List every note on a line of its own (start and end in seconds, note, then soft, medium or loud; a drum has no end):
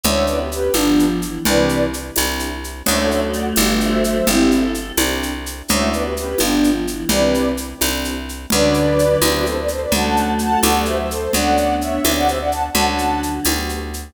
0.04 0.69 D2 loud
0.04 0.25 A3 loud
0.04 0.37 C#4 medium
0.04 0.37 D4 medium
0.04 0.37 E4 loud
0.04 0.37 F#4 loud
0.04 0.25 C#5 medium
0.04 0.25 E5 medium
0.04 low conga medium
0.04 shaker medium
0.27 0.51 B3 loud
0.27 0.39 B4 medium
0.27 0.39 D5 medium
0.27 shaker medium
0.39 0.50 G4 medium
0.39 0.50 B4 medium
0.51 0.71 C#4 loud
0.51 0.74 G4 medium
0.51 0.74 B4 medium
0.51 shaker medium
0.74 1.39 G1 medium
0.74 1.21 F3 loud
0.74 1.05 B3 medium
0.74 1.08 B3 medium
0.74 1.05 D4 medium
0.74 1.08 D4 medium
0.74 1.08 F4 loud
0.74 1.08 G4 medium
0.74 tambourine medium
0.74 high conga medium
0.74 shaker medium
0.99 shaker medium
1.22 1.43 E3 loud
1.22 shaker medium
1.45 2.11 C2 loud
1.45 1.86 C3 loud
1.45 1.86 E3 loud
1.45 1.79 C4 medium
1.45 1.79 D4 medium
1.45 1.79 E4 loud
1.45 1.79 G4 loud
1.45 1.85 B4 medium
1.45 1.85 D5 medium
1.45 low conga medium
1.45 shaker medium
1.69 shaker medium
1.93 shaker medium
2.16 2.82 C2 loud
2.16 2.49 C4 medium
2.16 2.49 D4 medium
2.16 2.49 E4 medium
2.16 2.49 G4 medium
2.16 tambourine medium
2.16 high conga medium
2.16 shaker medium
2.39 shaker medium
2.64 shaker medium
2.86 3.53 D2 loud
2.86 4.18 F#3 loud
2.86 4.18 A3 loud
2.86 3.20 C#4 loud
2.86 3.20 D4 loud
2.86 3.20 E4 medium
2.86 3.20 F#4 medium
2.86 2.98 C#5 medium
2.86 2.98 E5 medium
2.86 crash medium
2.86 low conga medium
2.86 shaker medium
2.98 3.09 A4 medium
2.98 3.09 C#5 medium
3.10 3.21 C#5 medium
3.10 3.21 E5 medium
3.10 shaker medium
3.33 3.45 D5 medium
3.33 3.45 F#5 medium
3.33 shaker medium
3.56 4.22 G1 loud
3.56 3.90 B3 loud
3.56 3.90 D4 loud
3.56 3.90 F4 medium
3.56 3.90 G4 loud
3.56 tambourine medium
3.56 high conga medium
3.56 shaker medium
3.81 4.03 C5 medium
3.81 4.03 E5 medium
3.81 shaker medium
4.04 4.27 C5 medium
4.04 4.27 E5 medium
4.04 shaker medium
4.27 4.92 G1 loud
4.27 4.66 C4 medium
4.27 4.61 C4 medium
4.27 4.61 D4 medium
4.27 4.66 E4 medium
4.27 4.61 E4 loud
4.27 4.61 G4 medium
4.27 4.51 G4 loud
4.27 low conga medium
4.27 shaker medium
4.51 4.91 A4 loud
4.51 shaker medium
4.75 shaker medium
4.97 5.62 C2 loud
4.97 5.31 C4 medium
4.97 5.31 D4 loud
4.97 5.31 E4 medium
4.97 5.31 G4 loud
4.97 tambourine medium
4.97 high conga medium
4.97 shaker medium
5.23 shaker medium
5.46 shaker medium
5.68 6.35 D2 loud
5.68 5.90 A3 loud
5.68 6.02 C#4 medium
5.68 6.02 D4 medium
5.68 6.02 E4 loud
5.68 6.02 F#4 loud
5.68 5.89 C#5 medium
5.68 5.89 E5 medium
5.68 low conga medium
5.68 shaker medium
5.92 6.15 B3 loud
5.92 6.03 B4 medium
5.92 6.04 D5 medium
5.92 shaker medium
6.03 6.15 G4 medium
6.03 6.15 B4 medium
6.16 6.35 C#4 loud
6.16 6.40 G4 medium
6.16 6.40 B4 medium
6.16 shaker medium
6.38 7.05 G1 medium
6.38 6.85 F3 loud
6.38 6.73 B3 medium
6.38 6.71 B3 medium
6.38 6.73 D4 medium
6.38 6.71 D4 medium
6.38 6.73 F4 loud
6.38 6.73 G4 medium
6.38 tambourine medium
6.38 high conga medium
6.38 shaker medium
6.64 shaker medium
6.87 7.08 E3 loud
6.87 shaker medium
7.09 7.74 C2 loud
7.09 7.51 C3 loud
7.09 7.51 E3 loud
7.09 7.43 C4 medium
7.09 7.43 D4 medium
7.09 7.43 E4 loud
7.09 7.43 G4 loud
7.09 7.49 B4 medium
7.09 7.49 D5 medium
7.09 low conga medium
7.09 shaker medium
7.34 shaker medium
7.57 shaker medium
7.81 8.46 C2 loud
7.81 8.14 C4 medium
7.81 8.14 D4 medium
7.81 8.14 E4 medium
7.81 8.14 G4 medium
7.81 tambourine medium
7.81 high conga medium
7.81 shaker medium
8.05 shaker medium
8.29 shaker medium
8.50 9.17 D2 loud
8.50 9.46 D3 loud
8.50 9.46 F#3 loud
8.50 8.85 C#4 loud
8.50 8.85 D4 medium
8.50 8.85 F#4 loud
8.50 8.85 A4 medium
8.50 9.18 B4 medium
8.50 9.18 D5 loud
8.50 low conga medium
8.50 shaker medium
8.74 shaker medium
8.99 shaker medium
9.22 9.86 D2 loud
9.22 9.55 B3 medium
9.22 9.55 C4 medium
9.22 9.55 E4 loud
9.22 9.55 G4 medium
9.22 9.33 B4 medium
9.22 9.33 D5 medium
9.22 tambourine medium
9.22 high conga medium
9.22 shaker medium
9.34 9.45 B4 medium
9.34 9.45 D5 medium
9.45 9.56 A4 medium
9.45 9.56 C5 medium
9.45 shaker medium
9.57 9.69 B4 medium
9.57 9.69 D5 medium
9.68 9.81 A4 medium
9.68 9.81 C5 medium
9.68 shaker medium
9.81 9.92 B4 medium
9.81 9.92 D5 medium
9.92 10.57 D2 loud
9.92 10.97 F#3 loud
9.92 10.97 A3 loud
9.92 10.26 A3 loud
9.92 10.26 C#4 medium
9.92 10.26 D4 medium
9.92 10.26 F#4 medium
9.92 10.30 F#5 medium
9.92 10.30 A5 medium
9.92 low conga medium
9.92 shaker medium
10.17 shaker medium
10.39 10.60 F#5 medium
10.39 10.60 A5 medium
10.39 shaker medium
10.63 11.28 D2 loud
10.63 10.96 A3 medium
10.63 10.96 B3 medium
10.63 10.96 F#4 loud
10.63 10.96 G4 medium
10.63 10.84 D5 medium
10.63 10.84 F#5 medium
10.63 tambourine medium
10.63 high conga medium
10.63 shaker medium
10.85 10.97 C5 medium
10.85 10.97 E5 medium
10.85 shaker medium
10.99 11.09 C5 medium
10.99 11.10 E5 medium
11.10 11.31 A4 medium
11.10 11.31 C5 medium
11.10 shaker medium
11.33 11.99 D2 loud
11.33 11.67 A3 loud
11.33 12.33 B3 medium
11.33 11.67 C#4 loud
11.33 12.33 D4 loud
11.33 11.67 D4 medium
11.33 11.67 F#4 medium
11.33 11.75 D5 medium
11.33 11.75 F#5 medium
11.33 low conga medium
11.33 shaker medium
11.57 shaker medium
11.80 12.11 C#5 medium
11.80 12.11 E5 medium
11.80 shaker medium
12.04 12.70 D2 loud
12.04 12.37 B3 medium
12.04 12.37 C4 medium
12.04 12.37 E4 medium
12.04 12.37 G4 medium
12.04 tambourine medium
12.04 high conga medium
12.04 shaker medium
12.17 12.28 D5 medium
12.17 12.28 F#5 loud
12.27 12.39 C5 medium
12.27 12.39 E5 medium
12.27 shaker medium
12.39 12.50 D5 medium
12.39 12.50 F#5 medium
12.52 12.63 F#5 medium
12.52 12.63 A5 medium
12.52 shaker medium
12.74 13.40 D2 loud
12.74 13.58 D3 medium
12.74 13.58 F#3 loud
12.74 13.08 A3 medium
12.74 13.08 C#4 medium
12.74 13.08 D4 medium
12.74 13.08 F#4 medium
12.74 12.86 F#5 medium
12.74 12.86 A5 loud
12.74 low conga medium
12.74 shaker medium
12.88 13.20 F#5 medium
12.88 13.20 A5 medium
12.98 shaker medium
13.23 shaker medium
13.45 14.10 D2 loud
13.45 13.79 A3 medium
13.45 13.79 B3 loud
13.45 13.79 F#4 loud
13.45 13.79 G4 medium
13.45 tambourine medium
13.45 high conga medium
13.45 shaker medium
13.69 shaker medium
13.94 shaker medium